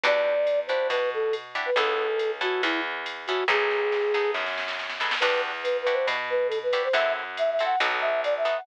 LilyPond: <<
  \new Staff \with { instrumentName = "Flute" } { \time 4/4 \key e \minor \tempo 4 = 139 d''4. c''8 b'8 a'8 r8. b'16 | a'4. fis'8 e'8 r4 fis'8 | gis'2 r2 | b'8 r8 \tuplet 3/2 { b'8 b'8 c''8 } r8 b'8 a'16 b'8 c''16 |
e''8 r8 \tuplet 3/2 { e''8 e''8 fis''8 } r8 e''8 d''16 e''8 fis''16 | }
  \new Staff \with { instrumentName = "Acoustic Guitar (steel)" } { \time 4/4 \key e \minor <d' e' fis' g'>4. <d' e' fis' g'>2 <d' e' fis' g'>8 | <b cis' e' a'>4. <b cis' e' a'>2 <b cis' e' a'>8 | <b dis' gis' a'>4. <b dis' gis' a'>2 <b dis' gis' a'>8 | <d' e' fis' g'>4. <d' e' fis' g'>2 <d' e' fis' g'>8 |
<c' e' fis' a'>4. <c' e' fis' a'>8 <b dis' fis' a'>4. <b dis' fis' a'>8 | }
  \new Staff \with { instrumentName = "Electric Bass (finger)" } { \clef bass \time 4/4 \key e \minor e,2 b,2 | cis,2 e,2 | b,,2 fis,2 | e,2 b,2 |
fis,2 b,,2 | }
  \new DrumStaff \with { instrumentName = "Drums" } \drummode { \time 4/4 cymr8 bd8 <hhp cymr>8 cymr8 <bd cymr>4 <hhp cymr>8 cymr8 | <bd cymr>4 <hhp cymr>8 cymr8 <bd cymr>4 <hhp cymr>8 cymr8 | <bd sn>8 sn8 sn8 sn8 sn16 sn16 sn16 sn16 sn16 sn16 sn16 sn16 | <cymc bd cymr>4 <hhp cymr>8 cymr8 <bd cymr>4 <hhp cymr>8 cymr8 |
<bd cymr>4 <hhp cymr>8 cymr8 <bd cymr>4 <hhp cymr>8 cymr8 | }
>>